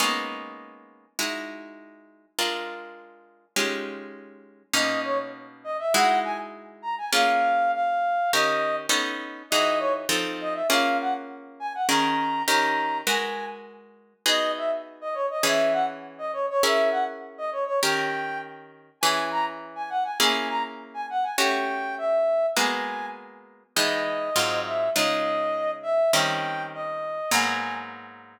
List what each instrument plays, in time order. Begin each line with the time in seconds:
0.00 acoustic guitar (steel) G#3 A#3 B3 C#4 D#4
1.19 acoustic guitar (steel) G#3 D#4 E4 F#4
2.39 acoustic guitar (steel) G#3 D4 F4 A#4
3.56 acoustic guitar (steel) G#3 C#4 D#4 F4 G4
4.73 acoustic guitar (steel) B2 A#3 C#4 D#4, brass section D#5
5.04 brass section C#5
5.64 brass section D#5
5.79 brass section E5
5.94 acoustic guitar (steel) G#3 D#4 E4 F#4, brass section F#5
6.24 brass section G#5
6.82 brass section A#5
6.98 brass section G#5
7.13 acoustic guitar (steel) A#3 C#4 F4 G#4, brass section F5
7.74 brass section F5
8.33 acoustic guitar (steel) D#3 C#4 G4 A#4, brass section D#5
8.89 acoustic guitar (steel) B3 C#4 D#4 A4
9.50 acoustic guitar (steel) E3 D#4 F#4 G#4, brass section D#5
9.79 brass section C#5
10.09 acoustic guitar (steel) F3 C4 D#4 A4
10.41 brass section D#5
10.54 brass section E5
10.69 acoustic guitar (steel) A#3 C#4 F4 G#4, brass section F5
11.01 brass section F#5
11.60 brass section G#5
11.75 brass section F#5
11.88 acoustic guitar (steel) D#3 C#4 G#4 A#4, brass section A#5
12.48 acoustic guitar (steel) D#3 C#4 G4 A#4, brass section A#5
13.07 acoustic guitar (steel) G#3 F#4 A#4 B4, brass section G#5
14.26 acoustic guitar (steel) B3 D#4 F#4 G#4, brass section D#5
14.57 brass section E5
15.01 brass section D#5
15.14 brass section C#5
15.31 brass section D#5
15.43 acoustic guitar (steel) E3 C#4 G#4 B4, brass section E5
15.72 brass section F#5
16.18 brass section D#5
16.33 brass section C#5
16.50 brass section C#5
16.63 acoustic guitar (steel) C#4 E4 G#4 A#4, brass section E5
16.91 brass section F#5
17.38 brass section D#5
17.52 brass section C#5
17.67 brass section C#5
17.83 acoustic guitar (steel) D#3 C#4 G4 A#4, brass section G5
19.01 acoustic guitar (steel) E3 C#4 G#4 B4, brass section G#5
19.31 brass section A#5
19.75 brass section G#5
19.90 brass section F#5
20.04 brass section G#5
20.20 acoustic guitar (steel) A#3 C#4 E4 G#4, brass section G#5
20.49 brass section A#5
20.94 brass section G#5
21.10 brass section F#5
21.23 brass section G#5
21.38 acoustic guitar (steel) A3 C#4 F#4 G4, brass section G5
21.98 brass section E5
22.56 acoustic guitar (steel) G#3 A#3 B3 F#4, brass section G#5
23.76 acoustic guitar (steel) E3 G#3 B3 D#4, brass section D#5
24.36 acoustic guitar (steel) G#2 F#3 C4 F4
24.66 brass section E5
24.95 acoustic guitar (steel) C#3 G#3 D#4 F4, brass section D#5
25.83 brass section E5
26.13 acoustic guitar (steel) D#3 G3 C4 C#4, brass section G5
26.74 brass section D#5
27.31 acoustic guitar (steel) G#2 F#3 A#3 B3, brass section G#5